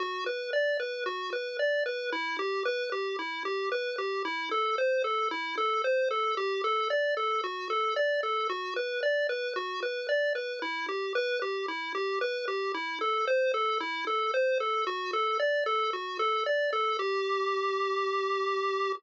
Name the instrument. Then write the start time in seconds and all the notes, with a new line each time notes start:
lead 1 (square)
0.00 F#4
0.26 B4
0.53 D5
0.80 B4
1.06 F#4
1.33 B4
1.59 D5
1.86 B4
2.12 E4
2.39 G4
2.65 B4
2.92 G4
3.19 E4
3.45 G4
3.72 B4
3.98 G4
4.25 E4
4.51 A4
4.78 C5
5.04 A4
5.31 E4
5.58 A4
5.84 C5
6.11 A4
6.37 G4
6.64 A4
6.90 D5
7.17 A4
7.44 F#4
7.70 A4
7.96 D5
8.23 A4
8.49 F#4
8.76 B4
9.03 D5
9.29 B4
9.56 F#4
9.83 B4
10.09 D5
10.35 B4
10.62 E4
10.88 G4
11.15 B4
11.42 G4
11.68 E4
11.95 G4
12.21 B4
12.48 G4
12.74 E4
13.01 A4
13.27 C5
13.54 A4
13.80 E4
14.07 A4
14.34 C5
14.60 A4
14.87 F#4
15.13 A4
15.39 D5
15.66 A4
15.93 F#4
16.19 A4
16.46 D5
16.73 A4
16.99 G4